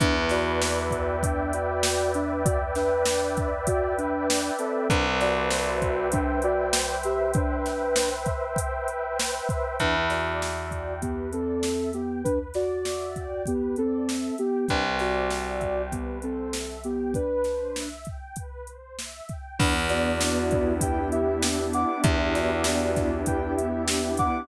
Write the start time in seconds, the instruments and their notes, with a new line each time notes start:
0.00 electric bass (finger) E2, ocarina D4 B4, pad 2 (warm) B4, kick, closed hi-hat
0.29 ocarina F#4 D5, pad 2 (warm) D5, snare, closed hi-hat
0.62 pad 2 (warm) E5, snare
0.91 pad 2 (warm) G5, kick, closed hi-hat
1.22 ocarina D4 B4, pad 2 (warm) B4, kick, closed hi-hat
1.53 ocarina F#4 D5, pad 2 (warm) D5, closed hi-hat
1.83 pad 2 (warm) E5, snare
2.14 ocarina D4 B4, pad 2 (warm) G5, closed hi-hat
2.45 ocarina F#4 D5, pad 2 (warm) B4, kick, closed hi-hat
2.75 ocarina D4 B4, pad 2 (warm) D5, snare, closed hi-hat
3.05 pad 2 (warm) E5, snare
3.37 pad 2 (warm) G5, kick, closed hi-hat
3.67 ocarina F#4 D5, pad 2 (warm) B4, kick, closed hi-hat
3.98 ocarina D4 B4, pad 2 (warm) D5, closed hi-hat
4.28 pad 2 (warm) E5, snare
4.59 ocarina C4 A4, pad 2 (warm) G5, closed hi-hat
4.90 electric bass (finger) C2, ocarina D4 B4, pad 2 (warm) B4, kick, closed hi-hat
5.20 ocarina F#4 D5, pad 2 (warm) C5, snare, closed hi-hat
5.51 pad 2 (warm) E5, snare
5.82 pad 2 (warm) G5, kick, closed hi-hat
6.12 ocarina D4 B4, pad 2 (warm) B4, kick, closed hi-hat
6.42 ocarina F#4 D5, pad 2 (warm) C5, closed hi-hat
6.72 pad 2 (warm) E5, snare
7.03 ocarina G4 E5, pad 2 (warm) G5, closed hi-hat
7.34 ocarina D4 B4, pad 2 (warm) B4, kick, closed hi-hat
7.66 pad 2 (warm) C5, snare, closed hi-hat
7.96 pad 2 (warm) E5, snare
8.26 pad 2 (warm) G5, kick, closed hi-hat
8.56 pad 2 (warm) B4, kick, closed hi-hat
8.88 pad 2 (warm) C5, closed hi-hat
9.18 pad 2 (warm) E5, snare
9.49 pad 2 (warm) G5, kick, closed hi-hat
9.79 electric bass (finger) E2, ocarina D4 B4, pad 2 (warm) B4, kick, closed hi-hat
10.10 ocarina F#4 D5, pad 2 (warm) D5, snare, closed hi-hat
10.40 pad 2 (warm) E5, snare
10.71 pad 2 (warm) G5, kick, closed hi-hat
11.02 ocarina B3 G4, pad 2 (warm) B4, kick, closed hi-hat
11.33 ocarina C4 A4, pad 2 (warm) D5, closed hi-hat
11.63 pad 2 (warm) E5, snare
11.93 ocarina B3 G4, pad 2 (warm) G5, closed hi-hat
12.24 ocarina D4 B4, pad 2 (warm) B4, kick, closed hi-hat
12.54 ocarina F#4 D5, pad 2 (warm) D5, snare, closed hi-hat
12.85 pad 2 (warm) E5, snare
13.16 pad 2 (warm) G5, kick, closed hi-hat
13.46 ocarina B3 G4, pad 2 (warm) B4, kick, closed hi-hat
13.76 ocarina C4 A4, pad 2 (warm) D5, closed hi-hat
14.08 pad 2 (warm) E5, snare
14.38 ocarina B3 G4, pad 2 (warm) G5, closed hi-hat
14.68 electric bass (finger) C2, ocarina D4 B4, pad 2 (warm) B4, kick, closed hi-hat
14.99 ocarina F#4 D5, pad 2 (warm) C5, snare, closed hi-hat
15.30 pad 2 (warm) E5, snare
15.61 pad 2 (warm) G5, kick, closed hi-hat
15.92 ocarina B3 G4, pad 2 (warm) B4, kick, closed hi-hat
16.22 ocarina C4 A4, pad 2 (warm) C5, closed hi-hat
16.53 pad 2 (warm) E5, snare
16.84 ocarina B3 G4, pad 2 (warm) G5, closed hi-hat
17.14 ocarina D4 B4, pad 2 (warm) B4, kick, closed hi-hat
17.44 pad 2 (warm) C5, snare, closed hi-hat
17.75 pad 2 (warm) E5, snare
18.05 pad 2 (warm) G5, kick, closed hi-hat
18.36 pad 2 (warm) B4, kick, closed hi-hat
18.67 pad 2 (warm) C5, closed hi-hat
18.98 pad 2 (warm) E5, snare
19.29 pad 2 (warm) G5, kick, closed hi-hat
19.59 electric bass (finger) E2, pad 2 (warm) B3, ocarina D4 B4, kick, crash
19.89 pad 2 (warm) D4, ocarina F#4 D5, snare, closed hi-hat
20.20 pad 2 (warm) E4, snare
20.51 pad 2 (warm) G4, kick, closed hi-hat
20.81 pad 2 (warm) B3, ocarina B4 G5, kick, closed hi-hat
21.12 pad 2 (warm) D4, ocarina G4 E5, closed hi-hat
21.42 pad 2 (warm) E4, snare
21.73 pad 2 (warm) G4, ocarina F#5 D6, closed hi-hat
22.04 electric bass (finger) E2, pad 2 (warm) B3, ocarina D4 B4, kick, closed hi-hat
22.34 pad 2 (warm) D4, ocarina F#4 D5, snare, closed hi-hat
22.64 pad 2 (warm) E4, snare
22.96 pad 2 (warm) G4, kick, snare, closed hi-hat
23.26 pad 2 (warm) B3, ocarina B4 G5, kick, closed hi-hat
23.57 pad 2 (warm) D4, ocarina G4 E5, closed hi-hat
23.87 pad 2 (warm) E4, snare
24.17 pad 2 (warm) G4, ocarina F#5 D6, kick, closed hi-hat